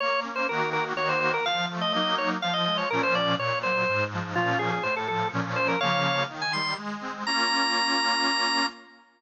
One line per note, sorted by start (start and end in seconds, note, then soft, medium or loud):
0.00 0.46 A#3 medium
0.00 0.20 C#5 loud
0.23 0.46 C#4 medium
0.36 0.47 C5 medium
0.49 0.93 D#3 loud
0.49 0.93 A#3 loud
0.49 0.93 F#4 loud
0.49 0.70 A#4 medium
0.73 0.84 A#4 loud
0.95 1.39 D#3 loud
0.95 1.39 A#3 loud
0.95 1.39 F#4 loud
0.95 1.08 C#5 medium
1.09 1.20 C5 medium
1.20 1.32 C5 medium
1.34 1.45 A#4 loud
1.45 1.91 F3 loud
1.45 1.66 F5 loud
1.70 1.93 A3 medium
1.81 1.93 D#5 medium
1.93 2.38 F#3 medium
1.93 2.38 A#3 loud
1.93 2.38 D#4 loud
1.93 2.16 D#5 medium
2.18 2.30 C#5 medium
2.42 2.88 F3 loud
2.42 2.54 F5 loud
2.54 2.65 D#5 medium
2.66 2.89 G#3 medium
2.66 2.77 D#5 medium
2.78 2.89 C#5 medium
2.90 3.35 A#2 loud
2.90 3.35 F3 loud
2.90 3.35 C#4 loud
2.90 3.02 A#4 loud
3.03 3.15 C5 loud
3.15 3.35 D5 loud
3.38 3.84 A#2 loud
3.38 3.59 C#5 medium
3.63 3.86 F#3 medium
3.63 4.04 C5 medium
3.88 4.34 G#2 loud
4.13 4.34 F3 medium
4.35 4.79 A#2 loud
4.35 4.79 F3 loud
4.35 4.79 C#4 medium
4.35 4.58 F4 loud
4.59 4.71 G#4 medium
4.72 4.83 G#4 medium
4.83 5.29 A2 loud
4.83 4.95 C5 medium
4.96 5.08 A4 medium
5.08 5.31 F3 medium
5.08 5.28 A4 loud
5.32 5.76 A#2 loud
5.32 5.76 F3 loud
5.32 5.76 C#4 loud
5.56 5.68 C5 loud
5.68 5.80 A#4 medium
5.81 6.24 C#3 loud
5.81 6.24 F3 medium
5.81 6.24 A#3 medium
5.81 6.23 C#5 medium
5.81 6.23 F5 medium
6.28 6.74 D#3 medium
6.42 6.53 G#5 medium
6.53 6.77 G3 medium
6.53 6.74 C6 medium
6.77 7.23 G#3 loud
7.01 7.23 C4 medium
7.27 8.66 A#3 loud
7.27 8.66 C#4 loud
7.27 8.66 F4 loud
7.27 8.66 A#5 loud